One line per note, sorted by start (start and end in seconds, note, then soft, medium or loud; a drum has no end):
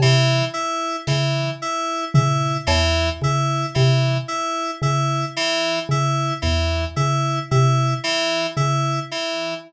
0.00 0.42 C3 medium
0.00 0.45 E3 medium
0.00 cowbell medium
0.54 0.96 E4 medium
1.07 1.50 C#3 medium
1.07 1.50 E3 medium
1.07 snare medium
1.62 2.05 E4 medium
2.14 2.58 C#3 medium
2.14 2.57 E4 medium
2.14 floor tom loud
2.67 3.10 E2 medium
2.67 3.09 E3 medium
2.67 cowbell loud
3.21 3.65 C#3 medium
3.21 3.66 E4 medium
3.21 kick medium
3.75 4.19 C3 medium
3.75 4.17 E3 medium
4.28 4.71 E4 medium
4.82 5.25 C#3 medium
4.82 5.25 E4 medium
5.36 5.79 E3 medium
5.89 6.32 C#3 medium
5.89 6.34 E4 medium
6.42 6.86 E2 medium
6.42 6.85 E3 medium
6.42 floor tom medium
6.96 7.40 C#3 medium
6.96 7.39 E4 medium
7.51 7.94 C3 medium
7.51 7.94 E4 medium
8.04 8.46 E3 medium
8.56 9.00 C#3 medium
8.56 8.99 E4 medium
9.11 9.54 E3 medium